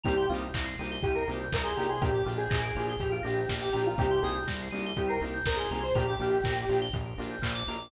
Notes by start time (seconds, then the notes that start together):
0.03 C2 A#3 C4 D#4 G4 A#5, kick, closed hi-hat
0.17 C6
0.29 C2 A#3 C4 D#4 F4 G4 D#6, open hi-hat
0.44 G6
0.54 C2 A#6, kick, clap
0.65 C7
0.79 C2 A#3 C4 D#4 G4 D#7, open hi-hat
0.91 G7
1.03 C2 G4 D#7, kick, closed hi-hat
1.15 A#4 C7
1.27 C2 A#3 C4 D#4 G4 A#6, open hi-hat
1.41 G6
1.52 C2 A#4 D#6, kick, clap
1.64 G#4 C6
1.76 C2 A#3 C4 D#4 G4 A#5, open hi-hat
1.89 G#4 C6
2.01 A#1 A#3 D4 F4 G4 A#5, kick, closed hi-hat
2.14 D6
2.25 A#1 A#3 D4 F4 G4 F6, open hi-hat
2.38 G#4 G6
2.50 A#1 A#6, kick, clap
2.63 D7
2.75 A#1 A#3 D4 F4 G4 F7, open hi-hat
2.89 G7
3.00 A#1 G4 F7, kick, closed hi-hat
3.12 F4 D7
3.23 A#1 A#3 D4 F4 G4 A#6, open hi-hat
3.37 G6
3.49 A#1 F6, kick, snare
3.61 G4 D6
3.72 A#1 A#3 D4 F4 G4 A#5, open hi-hat
3.87 F4
3.98 C2 A#3 C4 D#4 G4, kick, closed hi-hat
4.11 C6
4.22 C2 A#3 C4 D#4 G4 G#4 D#6, open hi-hat
4.35 G6
4.47 C2 A#6, kick, snare
4.62 C7
4.71 C2 A#3 C4 D#4 G4 D#7, open hi-hat
4.86 G7
4.97 C2 G4 D#7, kick, closed hi-hat
5.08 A#4 C7
5.20 C2 A#3 C4 D#4 G4 A#6, open hi-hat
5.34 G6
5.46 C2 A#4 D#6, kick, snare
5.56 G#4 C6
5.70 C2 A#3 C4 D#4 G4 G#4 A#5, open hi-hat
5.81 C5 C6
5.95 A#1 A#3 D4 F4 G4 A#5, kick, closed hi-hat
6.08 D6
6.19 A#1 A#3 D4 F4 G4 F6, open hi-hat
6.31 G6
6.44 A#1 A#6, kick, snare
6.58 D7
6.69 A#1 A#3 D4 F4 G4 F7, open hi-hat
6.82 G7
6.93 A#1 F7, kick, closed hi-hat
7.05 D7
7.18 A#1 A#3 D4 F4 G4 A#6, open hi-hat
7.31 G6
7.42 A#1 F6, kick, clap
7.55 D6
7.67 A#1 A#3 D4 F4 G4 A#5, open hi-hat
7.78 D6